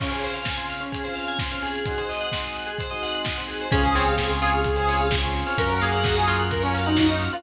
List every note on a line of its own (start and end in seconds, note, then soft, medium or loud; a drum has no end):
0.00 0.09 C#3 medium
0.00 0.09 C4 medium
0.00 0.10 C#4 medium
0.00 0.09 F4 medium
0.00 0.09 G#4 medium
0.00 kick medium
0.00 crash loud
0.11 0.40 C#3 medium
0.11 0.40 C4 medium
0.11 0.40 F4 medium
0.11 0.22 G#4 medium
0.11 0.40 G#4 medium
0.11 closed hi-hat medium
0.22 0.34 C5 medium
0.22 open hi-hat medium
0.34 0.45 F5 medium
0.34 closed hi-hat medium
0.45 0.84 C#3 medium
0.45 0.84 C4 medium
0.45 0.84 F4 medium
0.45 0.84 G#4 medium
0.45 0.58 G#5 medium
0.45 kick medium
0.45 snare medium
0.57 0.68 C6 medium
0.57 closed hi-hat medium
0.70 0.80 F6 medium
0.70 open hi-hat medium
0.81 0.91 C#4 medium
0.81 closed hi-hat medium
0.92 1.03 G#4 medium
0.92 kick medium
0.92 closed hi-hat loud
1.04 1.42 C#3 medium
1.04 1.42 C4 medium
1.04 1.42 F4 medium
1.04 1.42 G#4 medium
1.04 1.14 C5 medium
1.04 closed hi-hat medium
1.16 1.26 F5 medium
1.16 open hi-hat medium
1.27 1.38 G#5 medium
1.27 closed hi-hat medium
1.39 1.50 C6 medium
1.39 kick medium
1.39 snare medium
1.50 1.79 C#3 medium
1.50 1.79 C4 medium
1.50 1.79 F4 medium
1.50 1.79 G#4 medium
1.50 1.63 F6 medium
1.50 closed hi-hat medium
1.63 1.97 G#4 medium
1.63 open hi-hat medium
1.75 closed hi-hat medium
1.85 1.95 G#3 medium
1.85 1.95 C4 loud
1.85 1.95 D#4 medium
1.85 1.95 F#4 loud
1.85 kick medium
1.85 closed hi-hat loud
1.98 2.26 G#3 medium
1.98 2.26 C4 medium
1.98 2.26 D#4 medium
1.98 2.26 F#4 medium
1.98 2.08 C5 medium
1.98 closed hi-hat medium
2.09 2.20 D#5 medium
2.09 open hi-hat medium
2.21 2.31 F#5 medium
2.21 closed hi-hat medium
2.32 2.70 G#3 medium
2.32 2.70 C4 medium
2.32 2.70 D#4 medium
2.32 2.70 F#4 medium
2.32 2.43 C6 medium
2.32 kick medium
2.32 snare medium
2.44 2.55 D#6 medium
2.44 closed hi-hat medium
2.55 2.66 F#6 medium
2.55 open hi-hat medium
2.66 2.77 G#4 medium
2.66 closed hi-hat medium
2.78 2.90 C5 medium
2.78 kick medium
2.78 closed hi-hat medium
2.90 3.28 G#3 medium
2.90 3.28 C4 medium
2.90 3.28 D#4 medium
2.90 3.28 F#4 medium
2.90 3.01 D#5 medium
2.90 closed hi-hat medium
3.03 3.13 F#5 medium
3.03 open hi-hat medium
3.15 3.25 C6 medium
3.15 closed hi-hat medium
3.25 3.37 D#6 medium
3.25 kick medium
3.25 snare loud
3.36 3.65 G#3 medium
3.36 3.65 C4 medium
3.36 3.65 D#4 medium
3.36 3.65 F#4 medium
3.36 3.46 F#6 medium
3.36 closed hi-hat medium
3.48 3.59 G#4 medium
3.48 open hi-hat medium
3.60 3.72 C5 medium
3.60 closed hi-hat medium
3.71 5.44 C#2 loud
3.71 5.56 C4 medium
3.71 3.81 C4 loud
3.71 5.56 C#4 medium
3.71 3.81 C#4 loud
3.71 3.95 C#4 loud
3.71 5.56 F4 medium
3.71 3.81 F4 loud
3.71 3.81 G#4 medium
3.71 5.56 G#4 medium
3.71 3.81 G#4 loud
3.71 4.31 G#4 medium
3.71 kick loud
3.71 closed hi-hat loud
3.84 4.02 C4 medium
3.84 4.02 C#4 medium
3.84 4.02 F4 medium
3.84 4.02 G#4 medium
3.84 3.95 C5 medium
3.84 closed hi-hat medium
3.95 4.34 C4 medium
3.95 4.06 C#5 medium
3.95 open hi-hat medium
4.07 4.16 C4 medium
4.07 4.16 C#4 medium
4.07 4.16 F4 medium
4.07 4.16 G#4 loud
4.07 4.19 F5 medium
4.07 closed hi-hat medium
4.17 4.28 C4 medium
4.17 4.28 C#4 medium
4.17 4.28 F4 medium
4.17 4.28 G#4 medium
4.17 4.28 G#5 medium
4.17 kick medium
4.17 snare loud
4.30 4.39 C4 medium
4.30 4.39 C#4 medium
4.30 4.39 F4 medium
4.30 4.39 G#4 loud
4.30 4.40 C6 medium
4.30 closed hi-hat medium
4.42 4.70 C4 medium
4.42 4.70 C#4 medium
4.42 4.70 F4 medium
4.42 5.05 F4 medium
4.42 4.70 G#4 medium
4.42 5.09 G#4 medium
4.42 4.53 C#6 medium
4.42 open hi-hat medium
4.53 4.65 F6 medium
4.53 closed hi-hat medium
4.64 4.75 G#4 medium
4.64 kick medium
4.64 closed hi-hat medium
4.76 4.86 C4 medium
4.76 4.86 C#4 medium
4.76 4.86 F4 loud
4.76 4.86 G#4 loud
4.76 4.86 C5 medium
4.76 closed hi-hat medium
4.88 4.98 C4 medium
4.88 4.98 C#4 medium
4.88 4.98 F4 loud
4.88 4.98 G#4 medium
4.88 4.99 C#5 medium
4.88 open hi-hat medium
5.00 5.19 C4 medium
5.00 5.19 C#4 medium
5.00 5.19 F4 loud
5.00 5.19 G#4 medium
5.00 5.11 F5 medium
5.00 closed hi-hat medium
5.11 5.22 G#5 medium
5.11 kick medium
5.11 snare loud
5.23 5.42 C4 medium
5.23 5.42 C#4 medium
5.23 5.42 F4 medium
5.23 5.42 G#4 medium
5.23 5.33 C6 medium
5.23 closed hi-hat medium
5.34 5.45 C#6 medium
5.34 open hi-hat medium
5.46 5.56 C4 medium
5.46 5.56 C#4 medium
5.46 5.56 F4 loud
5.46 5.56 G#4 medium
5.46 5.57 F6 medium
5.46 open hi-hat medium
5.57 7.29 F#2 loud
5.57 7.42 A#3 medium
5.57 5.68 A#3 loud
5.57 7.42 C#4 medium
5.57 5.68 C#4 loud
5.57 5.80 C#4 loud
5.57 7.42 F4 medium
5.57 5.68 F4 medium
5.57 7.42 F#4 medium
5.57 5.68 F#4 loud
5.57 5.79 A#4 medium
5.57 5.69 A#4 medium
5.57 kick medium
5.57 closed hi-hat loud
5.69 5.88 A#3 medium
5.69 5.88 C#4 loud
5.69 5.88 F4 medium
5.69 5.88 F#4 medium
5.69 5.80 C#5 medium
5.69 closed hi-hat medium
5.81 6.20 A#3 medium
5.81 6.43 G#4 medium
5.81 5.92 F5 medium
5.81 open hi-hat medium
5.92 6.03 A#3 medium
5.92 6.03 C#4 medium
5.92 6.03 F4 medium
5.92 6.03 F#4 medium
5.92 6.02 F#5 medium
5.92 closed hi-hat medium
6.04 6.14 A#3 medium
6.04 6.14 C#4 medium
6.04 6.14 F4 medium
6.04 6.14 F#4 loud
6.04 6.16 A#5 medium
6.04 kick loud
6.04 snare loud
6.16 6.26 A#3 loud
6.16 6.26 C#4 medium
6.16 6.26 F4 medium
6.16 6.26 F#4 medium
6.16 6.27 C#6 medium
6.16 closed hi-hat medium
6.27 6.56 A#3 loud
6.27 6.56 C#4 medium
6.27 6.87 F4 medium
6.27 6.56 F4 medium
6.27 6.56 F#4 medium
6.27 6.37 F6 medium
6.27 open hi-hat medium
6.38 6.50 F#6 medium
6.38 closed hi-hat medium
6.51 6.61 A#4 medium
6.51 6.62 A#4 medium
6.51 kick medium
6.51 closed hi-hat loud
6.62 6.72 A#3 medium
6.62 6.74 C#4 medium
6.62 6.72 C#4 medium
6.62 6.72 F4 medium
6.62 6.72 F#4 medium
6.62 6.72 C#5 medium
6.62 closed hi-hat medium
6.74 6.84 A#3 loud
6.74 6.84 C#4 medium
6.74 6.84 F4 medium
6.74 6.84 F#4 medium
6.74 6.84 F5 medium
6.74 open hi-hat medium
6.86 7.05 A#3 medium
6.86 7.05 C#4 medium
6.86 6.97 D#4 medium
6.86 7.05 F4 medium
6.86 7.05 F#4 loud
6.86 6.96 F#5 medium
6.86 closed hi-hat medium
6.96 7.17 D#4 medium
6.96 7.09 A#5 medium
6.96 kick medium
6.96 snare loud
7.09 7.28 A#3 medium
7.09 7.28 C#4 medium
7.09 7.28 F4 medium
7.09 7.28 F#4 medium
7.09 7.19 C#6 medium
7.09 closed hi-hat medium
7.20 7.33 F6 medium
7.20 open hi-hat medium
7.33 7.42 A#3 medium
7.33 7.42 C#4 loud
7.33 7.42 F4 medium
7.33 7.43 F4 medium
7.33 7.42 F#4 loud
7.33 7.43 F#6 medium
7.33 closed hi-hat medium